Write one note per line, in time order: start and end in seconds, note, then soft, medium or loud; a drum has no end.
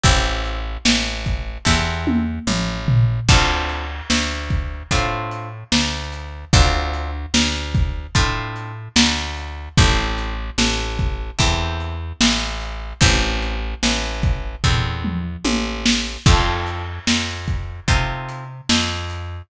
0.04 0.78 A1 loud
0.04 0.60 C4 loud
0.04 0.60 E4 loud
0.04 0.60 G4 loud
0.04 0.60 A4 loud
0.04 kick loud
0.04 closed hi-hat loud
0.45 closed hi-hat medium
0.85 1.58 A1 medium
0.85 snare loud
1.26 kick medium
1.26 closed hi-hat medium
1.65 2.39 E2 loud
1.65 2.22 C4 loud
1.65 2.22 E4 medium
1.65 2.22 G4 medium
1.65 2.22 A4 loud
1.65 kick medium
1.65 snare medium
2.07 high tom loud
2.47 3.20 A1 medium
2.47 mid tom medium
2.88 floor tom loud
3.29 4.02 D2 loud
3.29 3.86 C4 loud
3.29 3.86 D4 loud
3.29 3.86 F4 loud
3.29 3.86 A4 loud
3.29 kick loud
3.29 crash loud
3.69 closed hi-hat medium
4.10 4.83 D2 medium
4.10 snare loud
4.50 kick medium
4.50 closed hi-hat medium
4.91 5.64 A2 medium
4.91 5.49 C4 loud
4.91 5.49 D4 medium
4.91 5.49 F4 loud
4.91 5.49 A4 loud
4.91 kick medium
4.91 closed hi-hat loud
5.31 closed hi-hat medium
5.72 6.45 D2 medium
5.72 snare loud
6.13 closed hi-hat medium
6.53 7.26 D2 loud
6.53 7.10 C4 loud
6.53 7.10 D4 loud
6.53 7.10 F4 loud
6.53 7.10 A4 loud
6.53 kick loud
6.53 closed hi-hat loud
6.93 closed hi-hat medium
7.34 8.07 D2 loud
7.34 snare loud
7.75 kick loud
7.75 closed hi-hat medium
8.15 8.89 A2 loud
8.15 8.72 C4 medium
8.15 8.72 D4 medium
8.15 8.72 F4 medium
8.15 8.72 A4 loud
8.15 kick loud
8.15 closed hi-hat loud
8.56 closed hi-hat medium
8.96 9.69 D2 loud
8.96 snare loud
9.37 closed hi-hat medium
9.77 10.51 A1 loud
9.77 10.34 C4 loud
9.77 10.34 E4 loud
9.77 10.34 G4 loud
9.77 10.34 A4 loud
9.77 kick loud
9.77 closed hi-hat loud
10.18 closed hi-hat medium
10.58 11.31 A1 loud
10.58 snare loud
10.99 kick medium
10.99 closed hi-hat medium
11.39 12.13 E2 loud
11.39 11.95 C4 loud
11.39 11.95 E4 medium
11.39 11.95 G4 loud
11.39 11.95 A4 medium
11.39 kick loud
11.39 closed hi-hat loud
11.80 closed hi-hat medium
12.21 12.94 A1 loud
12.21 snare loud
12.61 closed hi-hat medium
13.01 13.75 A1 loud
13.01 13.57 C4 loud
13.01 13.57 E4 loud
13.01 13.57 G4 loud
13.01 13.57 A4 loud
13.01 kick loud
13.01 closed hi-hat loud
13.42 closed hi-hat medium
13.83 14.56 A1 medium
13.83 snare loud
14.23 kick loud
14.23 closed hi-hat medium
14.64 15.37 E2 medium
14.64 15.21 C4 loud
14.64 15.21 E4 medium
14.64 15.21 G4 loud
14.64 15.21 A4 medium
14.64 kick medium
14.64 floor tom medium
15.04 mid tom medium
15.45 16.18 A1 medium
15.45 high tom medium
15.86 snare loud
16.26 16.99 F2 loud
16.26 16.83 C4 loud
16.26 16.83 D#4 loud
16.26 16.83 F4 loud
16.26 16.83 A4 loud
16.26 kick loud
16.26 crash loud
16.67 closed hi-hat medium
17.07 17.80 F2 medium
17.07 snare loud
17.48 kick medium
17.48 closed hi-hat medium
17.88 18.61 C3 medium
17.88 18.45 C4 loud
17.88 18.45 D#4 loud
17.88 18.45 F4 loud
17.88 18.45 A4 medium
17.88 kick loud
17.88 closed hi-hat loud
18.29 closed hi-hat medium
18.69 19.42 F2 medium
18.69 snare loud
19.10 closed hi-hat medium